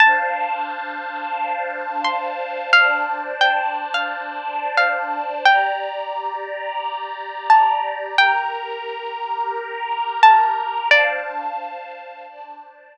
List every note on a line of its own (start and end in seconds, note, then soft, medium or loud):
0.00 2.70 D4 loud
0.00 2.70 C5 medium
0.00 2.70 F5 medium
0.00 1.79 A5 medium
0.00 2.70 A5 medium
2.05 2.63 C6 medium
2.73 5.43 D4 medium
2.73 5.43 C5 medium
2.73 5.43 D5 medium
2.73 3.35 F5 medium
2.73 5.43 A5 medium
3.41 3.85 G5 medium
3.94 4.74 F5 medium
4.77 5.34 F5 medium
5.45 8.16 G4 medium
5.45 8.16 D5 medium
5.45 7.12 G5 medium
5.45 8.16 A#5 medium
7.50 8.16 A5 medium
8.18 10.88 G4 medium
8.18 10.88 A#4 medium
8.18 10.07 G5 medium
8.18 10.88 A#5 medium
10.23 10.89 A5 medium
10.91 12.26 D4 medium
10.91 12.26 C5 medium
10.91 11.83 D5 medium
10.91 12.26 F5 medium
10.91 12.26 A5 medium
12.27 12.97 D4 medium
12.27 12.97 C5 medium
12.27 12.97 D5 loud
12.27 12.97 A5 loud